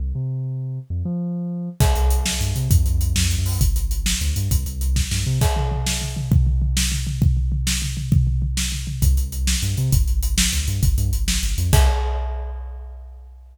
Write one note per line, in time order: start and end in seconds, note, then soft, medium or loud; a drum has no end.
0.00 0.13 C2 medium
0.15 0.79 C3 medium
0.90 1.03 F2 medium
1.05 1.69 F3 medium
1.80 1.93 C2 medium
1.80 kick loud
1.80 crash medium
1.95 2.34 C2 medium
1.95 closed hi-hat medium
2.11 closed hi-hat medium
2.26 snare medium
2.41 2.53 G2 medium
2.41 closed hi-hat medium
2.56 2.68 C3 medium
2.56 closed hi-hat medium
2.71 2.83 F2 medium
2.71 kick loud
2.71 closed hi-hat medium
2.86 3.14 F2 medium
2.86 closed hi-hat medium
3.01 closed hi-hat medium
3.16 3.36 F2 medium
3.16 snare loud
3.31 closed hi-hat medium
3.38 3.59 F#2 medium
3.46 open hi-hat medium
3.61 3.74 G1 loud
3.61 kick medium
3.61 closed hi-hat medium
3.76 4.14 G1 medium
3.76 closed hi-hat medium
3.91 closed hi-hat medium
4.06 snare loud
4.21 4.34 D2 medium
4.21 closed hi-hat medium
4.36 4.49 G2 medium
4.36 closed hi-hat medium
4.51 4.64 C2 medium
4.51 kick medium
4.51 closed hi-hat medium
4.66 5.05 C2 medium
4.66 closed hi-hat medium
4.81 closed hi-hat medium
4.96 kick medium
4.96 snare medium
5.11 5.24 G2 medium
5.11 snare medium
5.26 5.39 C3 medium
5.41 kick loud
5.41 crash medium
5.56 floor tom medium
5.71 floor tom medium
5.87 snare medium
6.01 floor tom medium
6.17 floor tom medium
6.32 kick loud
6.32 floor tom medium
6.47 floor tom medium
6.62 floor tom medium
6.77 snare loud
6.92 floor tom medium
7.07 floor tom medium
7.22 kick loud
7.22 floor tom medium
7.37 floor tom medium
7.52 floor tom medium
7.67 snare loud
7.82 floor tom medium
7.97 floor tom medium
8.12 kick loud
8.12 floor tom loud
8.27 floor tom medium
8.42 floor tom medium
8.57 snare medium
8.72 floor tom medium
8.87 floor tom medium
9.02 9.15 C2 medium
9.02 kick medium
9.02 closed hi-hat medium
9.17 9.56 C2 medium
9.17 closed hi-hat medium
9.32 closed hi-hat medium
9.47 snare medium
9.62 9.75 G2 medium
9.62 closed hi-hat medium
9.77 9.90 C3 medium
9.77 closed hi-hat medium
9.92 10.05 G1 loud
9.92 kick loud
9.92 closed hi-hat medium
10.08 10.46 G1 medium
10.08 closed hi-hat medium
10.23 closed hi-hat medium
10.38 snare loud
10.53 10.65 D2 medium
10.53 closed hi-hat medium
10.68 10.80 G2 medium
10.68 closed hi-hat medium
10.83 10.96 G1 medium
10.83 kick medium
10.83 closed hi-hat medium
10.98 11.11 G2 medium
10.98 closed hi-hat medium
11.13 11.38 G1 medium
11.13 closed hi-hat medium
11.28 snare loud
11.43 11.56 G1 medium
11.43 closed hi-hat medium
11.58 11.71 F2 medium
11.58 closed hi-hat medium
11.73 11.89 C2 loud
11.73 kick loud
11.73 crash loud